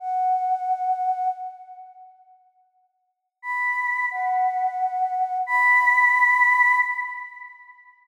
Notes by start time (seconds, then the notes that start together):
0.00 F#5
3.42 B5
4.11 F#5
5.47 B5